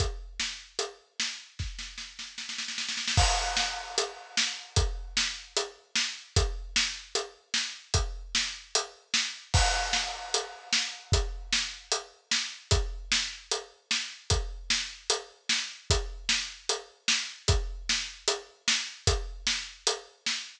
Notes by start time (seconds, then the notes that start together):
0.00 kick, closed hi-hat
0.40 snare
0.79 closed hi-hat
1.20 snare
1.59 kick, snare
1.79 snare
1.98 snare
2.19 snare
2.38 snare
2.49 snare
2.58 snare
2.68 snare
2.78 snare
2.89 snare
2.97 snare
3.08 snare
3.17 kick, crash
3.57 snare
3.98 closed hi-hat
4.37 snare
4.76 kick, closed hi-hat
5.17 snare
5.57 closed hi-hat
5.96 snare
6.36 kick, closed hi-hat
6.76 snare
7.15 closed hi-hat
7.54 snare
7.94 kick, closed hi-hat
8.35 snare
8.75 closed hi-hat
9.14 snare
9.54 kick, crash
9.93 snare
10.34 closed hi-hat
10.73 snare
11.12 kick, closed hi-hat
11.52 snare
11.92 closed hi-hat
12.31 snare
12.71 kick, closed hi-hat
13.12 snare
13.51 closed hi-hat
13.91 snare
14.30 kick, closed hi-hat
14.70 snare
15.10 closed hi-hat
15.49 snare
15.90 kick, closed hi-hat
16.29 snare
16.69 closed hi-hat
17.08 snare
17.48 kick, closed hi-hat
17.89 snare
18.28 closed hi-hat
18.68 snare
19.07 kick, closed hi-hat
19.47 snare
19.87 closed hi-hat
20.26 snare